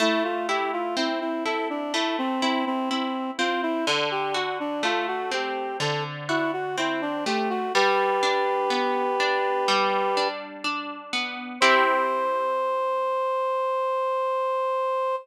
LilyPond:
<<
  \new Staff \with { instrumentName = "Clarinet" } { \time 4/4 \key c \major \tempo 4 = 62 e'16 f'16 g'16 f'16 e'16 e'16 a'16 d'16 e'16 c'16 c'16 c'16 c'8 f'16 e'16 | a'16 g'16 fis'16 d'16 eis'16 fis'16 g'8 a'16 r16 e'16 fis'16 e'16 d'16 g'16 fis'16 | <g' b'>2. r4 | c''1 | }
  \new Staff \with { instrumentName = "Orchestral Harp" } { \time 4/4 \key c \major a8 e'8 c'8 e'8 a8 e'8 e'8 c'8 | d8 fis'8 a8 c'8 d8 fis'8 c'8 a8 | g8 d'8 b8 d'8 g8 d'8 d'8 b8 | <c' e' g'>1 | }
>>